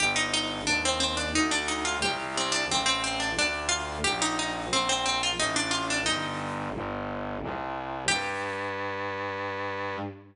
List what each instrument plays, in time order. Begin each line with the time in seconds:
0.00 violin G1, harpsichord G4
0.16 harpsichord D#4
0.34 harpsichord D#4
0.67 violin D#2, harpsichord D4
0.85 harpsichord C4
1.00 harpsichord C4
1.17 harpsichord D4
1.35 violin D2, harpsichord D#4
1.51 harpsichord D4
1.68 harpsichord D#4
1.85 harpsichord F4
2.02 violin C2, harpsichord G4
2.37 harpsichord C4
2.52 harpsichord D4
2.69 violin A1, harpsichord C4
2.86 harpsichord C4
3.04 harpsichord C4
3.20 harpsichord D4
3.36 violin D2, harpsichord D4
3.69 harpsichord F4
4.04 violin A#1, harpsichord G4
4.22 harpsichord D#4
4.39 harpsichord D#4
4.71 violin A#1, harpsichord C4
4.89 harpsichord C4
5.06 harpsichord C4
5.23 harpsichord F4
5.38 violin A1, harpsichord D#4
5.56 harpsichord D4
5.71 harpsichord F4
5.90 harpsichord D4
6.06 violin G1, harpsichord D#4
6.75 violin G1
7.42 violin C2
8.08 violin G2, harpsichord G4